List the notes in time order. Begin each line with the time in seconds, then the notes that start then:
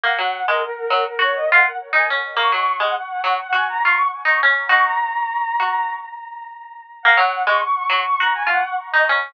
0.04 A#3 F#5
0.19 F#3
0.48 G#3 A#4
0.62 A#4
0.77 A#4
0.90 F#3
1.06 A#4
1.19 F#4 C#5
1.35 D#5
1.49 F4 F#5
1.93 D#4 G#5
2.10 C#4
2.37 A#3 C#6
2.52 F#3
2.80 G#3 F#5
2.95 F#5
3.09 F#5
3.24 F#3
3.39 F#5
3.53 F#4 G#5
3.69 A#5
3.82 F4 C#6
4.25 D#4 C#6
4.43 C#4
4.69 D#4 F#4 C#6
4.85 A#5
5.60 F#4
7.03 A#3 F#5
7.17 F#3
7.47 G#3 C#6
7.61 C#6
7.75 C#6
7.90 F#3
8.04 C#6
8.19 F#4 A#5
8.34 G#5
8.47 F4 F#5
8.92 D#4 D#5
9.09 C#4